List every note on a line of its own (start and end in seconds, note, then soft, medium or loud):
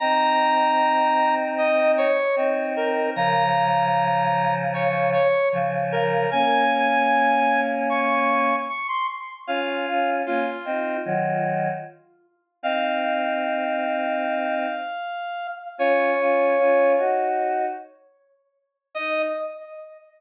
0.00 2.04 C4 loud
0.00 2.04 D#4 loud
0.00 1.35 A#5 medium
1.58 1.92 D#5 medium
1.98 2.36 C#5 medium
2.36 3.08 C4 medium
2.36 3.08 D#4 loud
2.76 3.11 A#4 medium
3.15 5.17 C#3 loud
3.15 5.17 F3 loud
3.15 4.55 A#5 medium
4.74 5.10 C#5 medium
5.13 5.49 C#5 medium
5.52 6.25 C#3 medium
5.52 6.25 F3 loud
5.92 6.30 A#4 medium
6.31 8.53 A#3 loud
6.31 8.53 C#4 loud
6.31 7.61 G#5 medium
7.89 8.56 C#6 medium
8.68 8.87 C#6 medium
8.88 9.07 C6 medium
9.47 9.85 C#4 loud
9.47 9.85 F4 loud
9.47 10.11 F5 medium
9.87 10.21 C#4 medium
9.87 10.21 F4 loud
10.26 10.45 A#3 medium
10.26 10.45 C#4 medium
10.26 10.97 F4 medium
10.65 10.97 C4 medium
10.65 10.97 D#4 loud
11.05 11.69 D#3 loud
11.05 11.69 F#3 loud
12.63 14.66 C4 loud
12.63 14.66 D#4 loud
12.63 15.47 F5 medium
15.78 16.14 C#4 loud
15.78 16.14 F4 loud
15.78 16.93 C#5 medium
16.18 16.54 C#4 medium
16.18 16.54 F4 medium
16.58 16.95 C#4 medium
16.58 16.95 F4 loud
16.97 17.64 D#4 medium
16.97 17.64 F#4 medium
18.95 19.23 D#4 loud
18.95 19.22 D#5 loud